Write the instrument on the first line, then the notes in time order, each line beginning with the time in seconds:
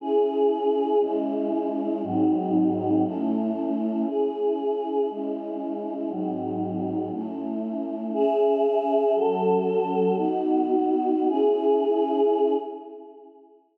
choir aahs
0.00 C#4 E4 G#4
1.01 G#3 C#4 E4
2.03 G#2 F#3 C4 D#4
3.04 A3 C#4 E4
4.07 C#4 E4 G#4
5.10 G#3 C#4 E4
6.10 G#2 F#3 C4 D#4
7.12 A3 C#4 E4
8.13 C#4 G#4 E5
9.14 F#3 C#4 A4
10.17 B3 D#4 F#4
11.28 C#4 E4 G#4